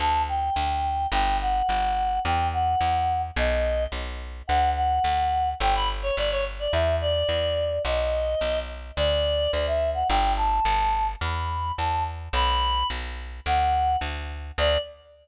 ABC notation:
X:1
M:2/4
L:1/16
Q:1/4=107
K:D
V:1 name="Choir Aahs"
a2 g6 | g2 f6 | g2 f6 | ^d4 z4 |
f2 f6 | g b z c d c z d | e2 d6 | ^d6 z2 |
d4 d e2 f | g2 a6 | b4 a2 z2 | b4 z4 |
f4 z4 | d4 z4 |]
V:2 name="Electric Bass (finger)" clef=bass
D,,4 D,,4 | G,,,4 G,,,4 | E,,4 E,,4 | B,,,4 B,,,4 |
D,,4 D,,4 | G,,,4 G,,,4 | E,,4 E,,4 | B,,,4 B,,,4 |
D,,4 D,,4 | G,,,4 G,,,4 | E,,4 E,,4 | B,,,4 B,,,4 |
D,,4 D,,4 | D,,4 z4 |]